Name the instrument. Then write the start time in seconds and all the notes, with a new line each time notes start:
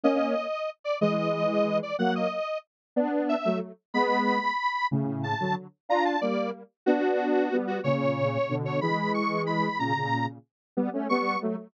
lead 1 (square)
0.03 A#3 C#4 D#5
0.84 D5
1.01 E3 G#3 D#5
1.83 D5
1.99 F#3 A#3 F#5
2.15 D#5
2.96 B3 D4
3.29 E5
3.45 F#3 A3
3.94 G#3 B3 B5
4.91 A2 C#3
5.23 A5
5.40 D3 F#3
5.89 D4 F4 A#5
6.05 A5
6.21 G3 A#3 D5
6.86 B3 D4 F#4
7.51 G3 B3
7.67 F#4
7.84 A#2 C#3 C#5
8.49 B2 D3
8.65 C#5
8.81 E3 G#3 B5
9.14 C#6
9.46 B5
9.79 A#2 C#3 A#5
9.95 A#2 C#3
10.77 G3 B3
10.93 A3 C#4
11.09 G3 B3 C#6
11.42 F#3 A3